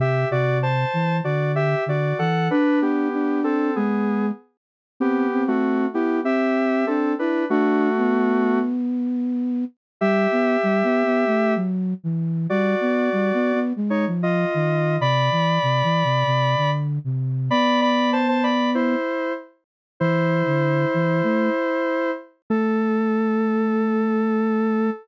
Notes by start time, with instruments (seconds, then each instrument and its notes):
0.00 flute C3, lead 1 (square) G4 E5
0.31 flute C3, lead 1 (square) F#4 D5
0.63 lead 1 (square) C5 A5
0.93 flute E3
1.24 flute D3, lead 1 (square) F#4 D5
1.55 lead 1 (square) G4 E5
1.86 flute D3, lead 1 (square) F#4 D5
2.19 flute E3, lead 1 (square) A4 F#5
2.51 lead 1 (square) D4 B4, flute D4
2.82 lead 1 (square) B3 G4
3.13 flute D4
3.44 lead 1 (square) C4 A4
3.76 flute G#3, lead 1 (square) B3 G#4
5.00 lead 1 (square) B3 G4, flute C4
5.32 flute C4
5.48 lead 1 (square) A3 F#4
5.93 lead 1 (square) B3 G4, flute E4
6.24 flute C4, lead 1 (square) G4 E5
6.87 lead 1 (square) C4 A4, flute D4
7.19 lead 1 (square) D4 B4, flute E4
7.50 lead 1 (square) A3 F#4, flute D4
7.97 flute B3
10.01 flute G3, lead 1 (square) G4 E5
10.32 flute B3
10.63 flute G3
10.83 flute B3
11.05 flute B3
11.26 flute A3
11.56 flute F#3
12.04 flute E3
12.50 flute G3, lead 1 (square) F#4 D5
12.81 flute B3
13.12 flute G3
13.34 flute B3
13.53 flute B3
13.76 flute G#3
13.90 lead 1 (square) D#4 C#5
14.07 flute F3
14.23 lead 1 (square) F4 D#5
14.54 flute D#3
15.00 flute C3, lead 1 (square) D5 B5
15.31 flute E3
15.63 flute C3
15.83 flute E3
16.04 flute C3
16.26 flute C3
16.57 flute D3
17.04 flute C3
17.50 flute B3, lead 1 (square) D5 B5
17.81 lead 1 (square) D5 B5
18.13 lead 1 (square) C5 A5
18.28 lead 1 (square) C5 A5
18.43 lead 1 (square) D5 B5
18.75 lead 1 (square) E4 C5
20.00 flute E3, lead 1 (square) E4 C5
20.46 flute D3
20.94 flute E3
21.23 flute A3
22.50 flute A3, lead 1 (square) A4